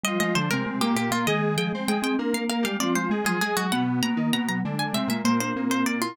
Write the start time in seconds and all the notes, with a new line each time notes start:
0.03 F3 G3 F4 D#5
0.20 F3 G#3 F4 D#5
0.35 D3 F3 D4 C5
0.51 C3 G#3 C4 A#4
0.66 G#3
0.81 A#2 A#3 G4
0.96 A#2 A#3 G4
1.11 A#2 A#3 F4
1.27 D#3 G#3 G#4 D#5
1.57 F3 G#3 G#4 G5
1.73 G#3 C4 C5
1.88 G#3 G#4 G5
2.02 C4 G5
2.18 A#3 D4 A#4
2.34 A#3 F5
2.49 A#3 A#4 F5
2.62 G3 G#3 G4 F5
2.80 F3 C4 F4 D5
2.95 G#3 C5
3.10 G#3 G#4
3.24 F3 F#3 F4 G#4
3.41 G#3 G#4
3.57 F#3 F#4
3.72 B2 B3 F#5
4.02 B2 A#3 B3 A#5
4.16 D#3 D#4
4.32 B2 A#3 B3 A#5
4.48 F#3 A#5
4.65 D3 G#3 D4
4.79 G#5
4.93 C3 G#3 C4 E5
5.08 A#2 G#3 A#3 E5
5.24 A#2 A#3 C5
5.40 D4 C5
5.56 A#2 A#3 C4
5.69 A#2 A#3 C5
5.85 A#2 A#3 D5
6.02 E4 F4